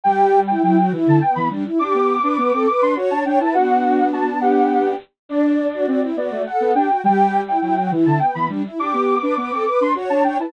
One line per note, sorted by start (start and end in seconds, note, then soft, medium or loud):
0.04 0.53 G3 loud
0.04 0.40 G4 loud
0.04 0.40 G5 loud
0.47 0.63 E4 medium
0.47 0.61 G5 medium
0.63 0.89 F#3 medium
0.63 0.77 E4 loud
0.63 0.76 G5 medium
0.77 0.93 F#4 loud
0.77 0.90 G5 medium
0.92 1.06 E3 loud
0.92 1.19 E4 loud
1.07 1.21 D3 loud
1.07 1.22 A5 medium
1.21 1.49 B3 medium
1.21 1.35 G5 medium
1.35 1.50 E3 medium
1.35 1.49 B5 medium
1.50 1.64 G3 medium
1.50 1.65 D4 loud
1.65 1.79 E4 medium
1.79 1.93 D4 loud
1.79 2.16 G4 loud
1.79 2.62 D6 loud
1.94 2.19 B3 medium
2.23 2.37 D4 loud
2.23 2.37 B4 loud
2.38 2.52 B3 loud
2.38 2.52 B4 medium
2.53 2.66 C4 medium
2.53 2.68 A4 loud
2.67 2.94 B4 loud
2.67 2.80 D6 medium
2.82 2.96 D4 medium
2.82 2.96 C6 medium
2.96 3.10 F#4 medium
2.96 3.24 C#5 loud
3.10 3.24 D4 medium
3.10 3.24 A5 loud
3.25 3.39 D4 loud
3.25 3.39 C#5 loud
3.25 3.39 G5 medium
3.40 3.54 E4 medium
3.40 3.55 B4 medium
3.40 3.54 A5 medium
3.54 4.94 B3 medium
3.54 4.94 D4 loud
3.54 4.06 F#4 loud
3.54 4.07 F#5 loud
4.13 4.26 F#4 loud
4.13 4.40 A5 medium
4.41 4.96 G4 medium
4.41 4.90 F#5 medium
5.29 5.67 D4 loud
5.29 5.86 D4 loud
5.29 6.03 D5 loud
5.74 5.86 F#4 loud
5.87 6.11 C4 medium
5.87 6.01 F#4 loud
6.03 6.16 E4 loud
6.16 6.30 B3 medium
6.16 6.42 F#4 medium
6.16 6.42 D5 medium
6.31 6.45 A3 loud
6.46 6.71 A4 loud
6.46 6.74 F#5 medium
6.60 6.74 B3 loud
6.75 6.89 D4 loud
6.75 6.89 G4 medium
6.75 7.01 G5 medium
6.89 7.03 F#4 medium
7.04 7.52 G3 loud
7.04 7.41 G4 loud
7.04 7.41 G5 loud
7.46 7.60 E4 medium
7.46 7.61 G5 medium
7.61 7.88 F#3 medium
7.61 7.75 E4 loud
7.61 7.75 G5 medium
7.77 7.91 F#4 loud
7.77 7.91 G5 medium
7.91 8.05 E3 loud
7.91 8.19 E4 loud
8.06 8.20 D3 loud
8.06 8.20 A5 medium
8.19 8.47 B3 medium
8.19 8.33 G5 medium
8.34 8.49 E3 medium
8.34 8.48 B5 medium
8.49 8.63 G3 medium
8.49 8.63 D4 loud
8.65 8.79 E4 medium
8.79 8.92 D4 loud
8.79 9.15 G4 loud
8.79 9.63 D6 loud
8.93 9.19 B3 medium
9.21 9.36 D4 loud
9.21 9.35 B4 loud
9.37 9.51 B3 loud
9.37 9.52 B4 medium
9.51 9.65 C4 medium
9.51 9.65 A4 loud
9.66 9.92 B4 loud
9.66 9.79 D6 medium
9.81 9.94 D4 medium
9.81 9.96 C6 medium
9.95 10.09 F#4 medium
9.95 10.23 C#5 loud
10.10 10.23 D4 medium
10.10 10.23 A5 loud
10.24 10.38 D4 loud
10.24 10.37 C#5 loud
10.24 10.38 G5 medium
10.39 10.52 E4 medium
10.39 10.52 B4 medium
10.39 10.52 A5 medium